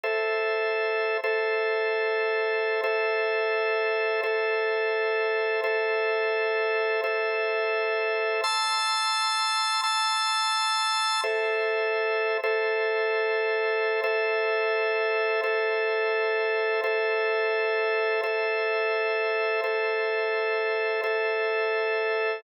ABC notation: X:1
M:7/8
L:1/8
Q:1/4=150
K:Aphr
V:1 name="Drawbar Organ"
[Ace]6 [Ace]- | [Ace]7 | [Ace]7 | [Ace]7 |
[Ace]7 | [Ace]7 | [ac'e']7 | [ac'e']7 |
[Ace]6 [Ace]- | [Ace]7 | [Ace]7 | [Ace]7 |
[Ace]7 | [Ace]7 | [Ace]7 | [Ace]7 |]